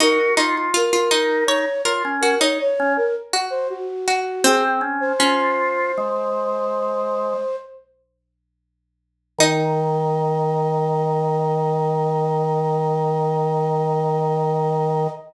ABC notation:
X:1
M:6/4
L:1/16
Q:1/4=81
K:Ebdor
V:1 name="Flute"
B2 z2 B4 d2 z2 B d d2 B z2 c G4 | "^rit." A z2 c15 z6 | e24 |]
V:2 name="Harpsichord"
E z E2 F F E2 d2 B2 G E z4 G2 z2 G2 | "^rit." C4 D14 z6 | E24 |]
V:3 name="Drawbar Organ"
G2 F F z2 E2 E z F D2 z2 D z8 | "^rit." C2 D2 F4 A,8 z8 | E,24 |]